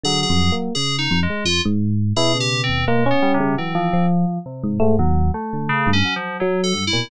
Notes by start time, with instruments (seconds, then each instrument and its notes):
0.04 electric piano 1 D3, electric piano 2 F#3 G#4
0.23 electric piano 2 G#4
0.30 electric piano 1 F2
0.52 electric piano 1 A#3
0.75 electric piano 1 C#3, electric piano 2 G#4
0.98 electric piano 2 D#4
1.11 electric piano 1 F2
1.23 electric piano 2 G#3
1.30 electric piano 1 G#3
1.45 electric piano 1 F2, electric piano 2 F4
1.65 electric piano 1 G#2
2.16 electric piano 2 B2 G#4, electric piano 1 E4
2.35 electric piano 1 C#3
2.40 electric piano 2 G4
2.64 electric piano 2 C4
2.69 electric piano 1 D#2
2.87 electric piano 2 G#3, electric piano 1 A#3
3.06 electric piano 1 C#4
3.11 electric piano 2 B3
3.22 electric piano 2 G3
3.34 electric piano 2 C3
3.40 electric piano 1 C#3
3.57 electric piano 1 E3, electric piano 2 F#3 C4
3.75 electric piano 2 F3
3.93 electric piano 1 F3
4.46 electric piano 2 C3
4.64 electric piano 1 G#2
4.80 electric piano 2 G#2, electric piano 1 A3
4.99 electric piano 1 D#2, electric piano 2 F#3
5.34 electric piano 2 A3
5.53 electric piano 1 D3
5.69 electric piano 2 C#3
5.87 electric piano 1 G2
5.93 electric piano 2 C#4
6.05 electric piano 2 F#3
6.16 electric piano 2 F3
6.40 electric piano 2 F#3, electric piano 1 F#3
6.64 electric piano 2 A4
6.74 electric piano 1 G2
6.87 electric piano 2 E4
6.93 electric piano 2 A#2, electric piano 1 B2